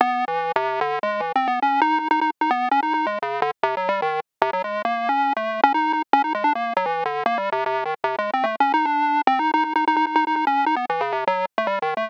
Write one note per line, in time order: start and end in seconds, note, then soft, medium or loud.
0.01 0.25 B3 loud
0.28 0.52 E3 medium
0.56 0.80 C3 loud
0.81 0.99 D3 loud
1.03 1.21 G#3 loud
1.20 1.32 E3 medium
1.35 1.48 C4 medium
1.47 1.60 B3 medium
1.62 1.80 C#4 medium
1.81 1.99 D#4 loud
1.99 2.08 D#4 medium
2.11 2.20 D#4 loud
2.21 2.30 D#4 medium
2.41 2.50 D#4 medium
2.51 2.69 B3 medium
2.71 2.80 C#4 loud
2.83 2.93 D#4 medium
2.94 3.06 D#4 medium
3.06 3.19 G#3 medium
3.22 3.41 C#3 soft
3.42 3.51 D3 loud
3.63 3.75 C3 loud
3.77 3.89 F#3 medium
3.89 4.01 G3 loud
4.02 4.20 D#3 loud
4.42 4.51 C3 loud
4.53 4.62 F#3 medium
4.64 4.82 G#3 medium
4.85 5.09 A#3 medium
5.09 5.33 C#4 medium
5.36 5.61 A3 medium
5.64 5.73 C#4 loud
5.74 5.92 D#4 medium
5.93 6.02 D#4 medium
6.13 6.22 C#4 loud
6.24 6.33 D#4 medium
6.35 6.44 G#3 medium
6.44 6.53 D4 medium
6.55 6.73 A#3 medium
6.77 6.86 F#3 medium
6.86 7.04 E3 medium
7.05 7.23 D3 medium
7.26 7.38 A#3 loud
7.38 7.50 G3 medium
7.52 7.64 C3 loud
7.66 7.84 C3 loud
7.85 7.94 D#3 medium
8.04 8.16 C3 medium
8.18 8.31 G#3 medium
8.33 8.46 C4 medium
8.44 8.56 A3 medium
8.60 8.72 C#4 medium
8.74 8.86 D#4 medium
8.85 9.21 D4 medium
9.27 9.39 C4 loud
9.39 9.51 D#4 medium
9.54 9.64 D#4 loud
9.64 9.73 D#4 medium
9.76 9.85 D#4 medium
9.87 9.96 D#4 medium
9.96 10.06 D#4 loud
10.07 10.15 D#4 medium
10.16 10.25 D#4 loud
10.27 10.35 D#4 medium
10.36 10.45 D#4 medium
10.47 10.65 C#4 medium
10.66 10.75 D#4 medium
10.76 10.85 B3 medium
10.90 11.02 E3 medium
11.01 11.13 C#3 medium
11.12 11.24 C3 medium
11.27 11.45 F#3 loud
11.58 11.67 A3 medium
11.67 11.79 G3 loud
11.82 11.94 D#3 medium
11.97 12.09 A3 medium